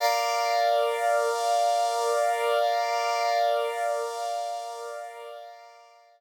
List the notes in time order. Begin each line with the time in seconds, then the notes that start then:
0.00 A#4 D5 F5